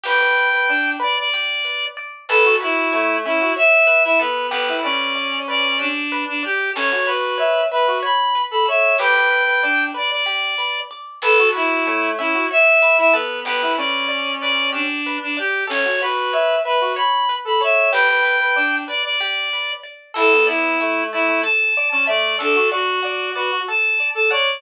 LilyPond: <<
  \new Staff \with { instrumentName = "Clarinet" } { \time 7/8 \key a \mixolydian \tempo 4 = 94 g''4. d''16 d''4~ d''16 r8 | a'8 e'4 e'8 e''8. e''16 b'8 | b'8 d''4 d''8 d'8. d'16 g'8 | cis''8 b'4 b'8 b''8. b''16 e''8 |
g''4. d''16 d''4~ d''16 r8 | a'8 e'4 e'8 e''8. e''16 b'8 | b'8 d''4 d''8 d'8. d'16 g'8 | cis''8 b'4 b'8 b''8. b''16 e''8 |
g''4. d''16 d''4~ d''16 r8 | a'8 e'4 e'8 a''8. a''16 d''8 | a'8 fis'4 fis'8 a''8. a''16 d''8 | }
  \new Staff \with { instrumentName = "Clarinet" } { \time 7/8 \key a \mixolydian b'16 b'8 b'16 d'8 r2 | b'16 fis'16 fis'8 a8 cis'16 fis'16 r8. e'16 b8 | b16 e'16 cis'2 r4 | cis'16 fis'16 fis'8 e''8 b'16 fis'16 r8. a'16 cis''8 |
b'16 b'8 b'16 d'8 r2 | b'16 fis'16 fis'8 a8 cis'16 fis'16 r8. e'16 b8 | b16 e'16 cis'2 r4 | cis'16 fis'16 fis'8 e''8 b'16 fis'16 r8. a'16 cis''8 |
b'16 b'8 b'16 d'8 r2 | e'16 b16 b8 a8 a16 a16 r8. cis'16 a8 | d'16 fis'16 fis'8 d''8 b'16 fis'16 r8. a'16 cis''8 | }
  \new Staff \with { instrumentName = "Pizzicato Strings" } { \time 7/8 \key a \mixolydian g'8 b'8 d''8 b'8 g'8 b'8 d''8 | a'8 b'8 cis''8 e''8 cis''8 b'8 a'8 | g'8 b'8 d''8 b'8 g'8 b'8 d''8 | a'8 b'8 cis''8 e''8 cis''8 b'8 a'8 |
g'8 b'8 d''8 b'8 g'8 b'8 d''8 | a'8 b'8 cis''8 e''8 cis''8 b'8 a'8 | g'8 b'8 d''8 b'8 g'8 b'8 d''8 | a'8 b'8 cis''8 e''8 cis''8 b'8 a'8 |
g'8 b'8 d''8 b'8 g'8 b'8 d''8 | a'8 d''8 e''8 d''8 a'8 d''8 e''8 | a'8 d''8 fis''8 d''8 a'8 d''8 fis''8 | }
  \new Staff \with { instrumentName = "Electric Bass (finger)" } { \clef bass \time 7/8 \key a \mixolydian g,,2.~ g,,8 | a,,2.~ a,,8 | g,,2.~ g,,8 | a,,2.~ a,,8 |
g,,2.~ g,,8 | a,,2.~ a,,8 | g,,2.~ g,,8 | a,,2.~ a,,8 |
g,,2.~ g,,8 | a,,2.~ a,,8 | d,2.~ d,8 | }
>>